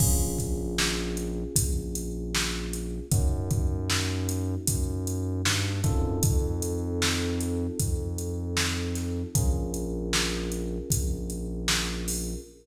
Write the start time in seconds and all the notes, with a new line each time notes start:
0.00 A#1 A#3 C#4 F4 G#4, kick, crash
0.38 kick, closed hi-hat
0.78 snare
1.17 closed hi-hat
1.56 A#1, kick, closed hi-hat
1.95 closed hi-hat
2.35 snare
2.73 closed hi-hat
3.12 F#2 A#3 C#4 D#4 F#4, kick, closed hi-hat
3.51 kick, closed hi-hat
3.90 snare
4.29 closed hi-hat
4.67 F#2, kick, closed hi-hat
5.07 closed hi-hat
5.45 G2, snare
5.84 F#2 C4 D#4 F4 A4, kick, closed hi-hat
6.23 F2, kick, closed hi-hat
6.62 closed hi-hat
7.02 snare
7.41 closed hi-hat
7.79 F2, kick, closed hi-hat
8.18 closed hi-hat
8.57 snare
8.95 snare, closed hi-hat
9.35 A#1 C#4 F4 G#4 A#4, kick, closed hi-hat
9.74 closed hi-hat
10.13 snare
10.52 closed hi-hat
10.90 A#1, kick, closed hi-hat
11.30 closed hi-hat
11.68 snare
12.08 open hi-hat